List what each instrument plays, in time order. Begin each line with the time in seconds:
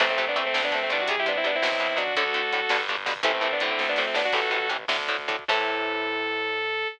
0.00 electric bass (finger) A1, overdriven guitar C3 E3 A3, lead 2 (sawtooth) A3 C4, kick, crash
0.09 lead 2 (sawtooth) A3 C4, kick
0.18 overdriven guitar C3 E3 A3, lead 2 (sawtooth) A3 C4, kick, closed hi-hat
0.27 lead 2 (sawtooth) B3 D4, kick
0.35 overdriven guitar C3 E3 A3, lead 2 (sawtooth) A3 C4, kick, closed hi-hat
0.46 lead 2 (sawtooth) A3 C4, kick
0.54 electric bass (finger) D2, overdriven guitar D3 A3, lead 2 (sawtooth) A3 C4, kick, snare
0.63 lead 2 (sawtooth) B3 D4, kick
0.71 overdriven guitar D3 A3, lead 2 (sawtooth) A3 C4, kick, closed hi-hat
0.81 lead 2 (sawtooth) A3 C4, kick
0.90 electric bass (finger) C2, overdriven guitar D3 A3, lead 2 (sawtooth) B3 D4, kick, closed hi-hat
0.99 lead 2 (sawtooth) D4 F#4, kick
1.08 overdriven guitar C3 G3, lead 2 (sawtooth) G#4, kick, closed hi-hat
1.17 lead 2 (sawtooth) E4 G4, kick
1.26 overdriven guitar C3 G3, lead 2 (sawtooth) B3 D4, kick, closed hi-hat
1.35 lead 2 (sawtooth) C4 E4, kick
1.44 overdriven guitar C3 G3, lead 2 (sawtooth) B3 D4, kick, closed hi-hat
1.52 lead 2 (sawtooth) C4 E4, kick
1.62 electric bass (finger) B1, overdriven guitar B2 F#3, kick, snare
1.72 kick
1.79 overdriven guitar B2 F#3, kick, closed hi-hat
1.88 kick
1.96 overdriven guitar B2 F#3, lead 2 (sawtooth) D4 F#4, kick, closed hi-hat
2.07 kick
2.15 electric bass (finger) D2, overdriven guitar A2 D3, lead 2 (sawtooth) F#4 A4, kick, closed hi-hat
2.26 kick
2.34 overdriven guitar A2 D3, kick, closed hi-hat
2.43 kick
2.53 overdriven guitar A2 D3, kick, closed hi-hat
2.61 kick
2.69 electric bass (finger) G1, overdriven guitar G2 B2 D3, kick, snare
2.79 kick
2.89 overdriven guitar G2 B2 D3, kick, closed hi-hat
2.97 kick
3.06 overdriven guitar G2 B2 D3, kick, open hi-hat
3.16 kick
3.23 electric bass (finger) A1, overdriven guitar A2 C3 E3, lead 2 (sawtooth) A3 C4, kick, closed hi-hat
3.34 lead 2 (sawtooth) A3 C4, kick
3.41 overdriven guitar A2 C3 E3, lead 2 (sawtooth) A3 C4, kick, closed hi-hat
3.51 lead 2 (sawtooth) B3 D4, kick
3.60 overdriven guitar A2 D3, lead 2 (sawtooth) A3 C4, kick, closed hi-hat
3.69 lead 2 (sawtooth) A3 C4, kick
3.78 electric bass (finger) D2, lead 2 (sawtooth) A3 C4, kick, snare
3.89 lead 2 (sawtooth) B3 D4
3.96 overdriven guitar A2 D3, lead 2 (sawtooth) A3 C4, snare
4.07 lead 2 (sawtooth) A3 C4
4.14 overdriven guitar A2 D3, lead 2 (sawtooth) B3 D4, snare
4.25 lead 2 (sawtooth) D4 F#4
4.33 electric bass (finger) A1, overdriven guitar A2 C3 E3, lead 2 (sawtooth) F#4 A4, kick, crash
4.41 kick
4.50 overdriven guitar A2 C3 E3, kick, closed hi-hat
4.60 kick
4.69 overdriven guitar A2 C3 E3, kick, closed hi-hat
4.79 kick
4.88 electric bass (finger) D2, overdriven guitar A2 D3, kick, snare
4.99 kick
5.08 overdriven guitar A2 D3, kick, closed hi-hat
5.19 kick
5.28 overdriven guitar A2 D3, kick, closed hi-hat
5.39 kick
5.48 electric bass (finger) A2, overdriven guitar C3 E3 A3, lead 2 (sawtooth) A4, kick, crash